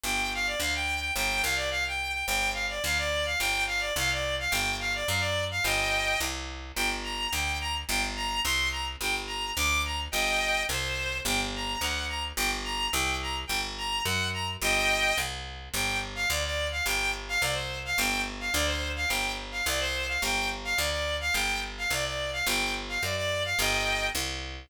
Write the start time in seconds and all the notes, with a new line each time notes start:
0.04 G1 G5
0.34 F5
0.47 D5
0.60 D2 F5
0.75 G5
1.00 G5
1.16 G1 G5
1.43 C2 F5
1.56 D5
1.71 F5
1.88 G5
2.13 G5
2.27 G1 G5
2.54 F5
2.69 D5
2.84 D2 F5
2.98 D5
3.26 F5
3.39 G1 G5
3.67 F5
3.80 D5
3.96 C2 F5
4.12 D5
4.39 F5
4.50 G1 G5
4.80 F5
4.95 D5
5.08 F#2 F5
5.20 D5
5.51 F5
5.64 G1 D#5 G5
6.20 C2
6.76 G1 G5
7.04 A#5
7.33 D2 G5
7.61 A#5
7.89 G1 G5
8.16 A#5
8.44 C2 C6
8.72 A#5
9.01 G1 G5
9.27 A#5
9.57 D2 D6
9.85 A#5
10.12 G1 D#5 G5
10.69 C2 C5
11.25 G1 G5
11.55 A#5
11.80 D2 F#5
12.09 A#5
12.37 G1 G5
12.64 A#5
12.92 C2 G5
13.22 A#5
13.47 G1 G5
13.78 A#5
14.05 F#2 F#5
14.34 A#5
14.62 G1 D#5 G5
15.18 C2
15.74 G1 G5
16.15 F5
16.30 D2 D5
16.45 D5
16.72 F5
16.86 G1 G5
17.29 F5
17.41 C2 D5
17.54 C5
17.85 F5
17.98 G1 G5
18.40 F5
18.53 D2 D5
18.66 C5
18.96 F5
19.08 G1 G5
19.52 F5
19.66 C2 D5
19.80 C5
20.08 F5
20.22 G1 G5
20.64 F5
20.77 D2 D5
20.91 D5
21.21 F5
21.34 G1 G5
21.78 F5
21.90 C2 D5
22.05 D5
22.33 F5
22.46 G1 G5
22.89 F5
23.03 F#2 D5
23.16 D5
23.45 F5
23.59 G1 D#5 G5
24.15 C2